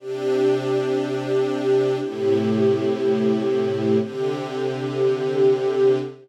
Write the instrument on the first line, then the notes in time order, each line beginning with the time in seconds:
string ensemble 1
0.00 C3 D4 G4
1.99 A2 C3 E4 G4
4.00 C3 D3 G4